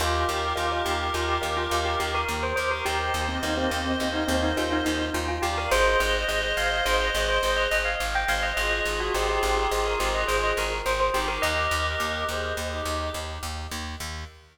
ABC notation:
X:1
M:5/4
L:1/16
Q:1/4=105
K:Eb
V:1 name="Tubular Bells"
F2 G2 F2 G2 F G2 F2 G G B2 c c B | G3 C E C C C2 E C E F E E2 F F G B | c2 e2 e2 f2 c e2 c2 e e f2 g f e | e3 ^F G G G G2 B G e c e B2 c c G B |
e12 z8 |]
V:2 name="Clarinet"
[GB]16 z2 [GB] [GB] | [ce]16 z2 [df] [df] | [ce]16 z2 [ce] [ce] | [FA]16 z2 [EG] [EG] |
[GB]6 [Ac]2 z [EG]3 z8 |]
V:3 name="Vibraphone"
[GBef]4 [GBef] [GBef]3 [GBef]2 [GBef]2 [GBef]8- | [GBef]4 [GBef] [GBef]3 [GBef]2 [GBef]2 [GBef]8 | [Ace]4 [Ace] [Ace]3 [Ace]2 [Ace]2 [Ace]8- | [Ace]4 [Ace] [Ace]3 [Ace]2 [Ace]2 [Ace]8 |
z20 |]
V:4 name="Electric Bass (finger)" clef=bass
E,,2 E,,2 E,,2 E,,2 E,,2 E,,2 E,,2 E,,2 E,,2 E,,2 | E,,2 E,,2 E,,2 E,,2 E,,2 E,,2 E,,2 E,,2 E,,2 E,,2 | A,,,2 A,,,2 A,,,2 A,,,2 A,,,2 A,,,2 A,,,2 A,,,2 A,,,2 A,,,2 | A,,,2 A,,,2 A,,,2 A,,,2 A,,,2 A,,,2 A,,,2 A,,,2 A,,,2 A,,,2 |
E,,2 E,,2 E,,2 E,,2 E,,2 E,,2 E,,2 E,,2 E,,2 E,,2 |]